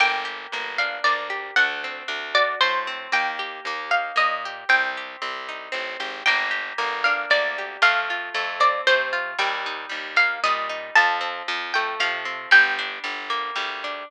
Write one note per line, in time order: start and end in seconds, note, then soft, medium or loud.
0.00 0.47 G1 loud
0.00 0.53 A#3 medium
0.00 0.70 G5 medium
0.25 1.29 G4 medium
0.52 0.99 G1 medium
0.52 1.04 A#3 medium
0.78 1.54 D4 medium
0.78 1.02 F5 medium
1.04 1.51 D2 medium
1.04 1.54 A#3 medium
1.04 1.52 D5 medium
1.30 1.55 G4 medium
1.56 2.03 D2 loud
1.56 2.60 A3 medium
1.56 2.29 F#5 medium
1.84 2.87 C4 medium
2.08 2.55 D2 medium
2.08 3.07 D4 medium
2.35 3.09 F#4 medium
2.35 2.59 D5 medium
2.61 3.08 A2 medium
2.61 3.10 A3 medium
2.61 3.08 C5 medium
2.87 3.12 C4 medium
3.12 3.60 D#2 medium
3.12 3.66 A#3 medium
3.12 3.83 G5 medium
3.39 4.45 G4 medium
3.65 4.12 D#2 medium
3.65 4.15 A#3 medium
3.91 4.65 D#4 soft
3.91 4.16 F5 medium
4.16 4.64 A#2 medium
4.16 4.65 A#3 medium
4.16 4.62 D#5 medium
4.45 4.70 G4 medium
4.69 5.16 C2 loud
4.69 5.21 C4 medium
4.69 5.15 G5 medium
4.97 6.00 G4 soft
5.22 5.69 C2 medium
5.22 5.72 C4 medium
5.49 6.23 D#4 medium
5.72 5.97 A1 medium
5.72 6.22 C4 medium
6.00 6.23 G#1 medium
6.00 6.25 G4 medium
6.26 6.73 G1 loud
6.26 6.78 A#3 medium
6.26 7.01 G5 medium
6.51 7.58 G4 medium
6.78 7.26 G1 medium
6.78 7.30 A#3 medium
7.04 7.80 D4 medium
7.04 7.30 F5 medium
7.30 7.77 D2 medium
7.30 7.80 A#3 medium
7.30 7.79 D5 medium
7.58 7.83 G4 medium
7.82 8.30 F2 loud
7.82 8.34 A3 medium
7.82 8.48 F5 medium
8.10 9.12 F4 medium
8.34 8.81 F2 medium
8.34 8.87 A3 medium
8.60 9.35 C4 medium
8.60 8.82 D5 medium
8.87 9.34 C3 medium
8.87 9.37 A3 medium
8.87 9.31 C5 medium
9.13 9.38 F4 medium
9.39 9.86 D#2 loud
9.39 9.89 G3 medium
9.39 10.13 G5 medium
9.66 10.69 D#4 medium
9.89 10.38 D#2 medium
9.89 10.45 G3 medium
10.16 10.91 A#3 medium
10.16 10.40 F5 medium
10.44 10.91 A#2 medium
10.44 10.95 G3 medium
10.44 10.90 D#5 medium
10.69 10.94 D#4 medium
10.95 11.43 F2 loud
10.95 11.48 F3 medium
10.95 11.70 A5 medium
11.21 12.25 C4 medium
11.48 11.95 F2 medium
11.48 12.00 F3 medium
11.74 12.50 A3 medium
11.74 11.95 G5 medium
12.00 12.47 C3 medium
12.00 12.50 F3 medium
12.00 12.51 F5 medium
12.25 12.50 C4 medium
12.51 12.99 G1 loud
12.51 13.03 G3 medium
12.51 13.03 G5 medium
12.79 13.83 D4 medium
13.04 13.51 G1 medium
13.04 13.55 G3 medium
13.30 14.04 A#3 medium
13.56 14.03 D2 medium
13.56 14.05 G3 medium
13.84 14.09 D4 medium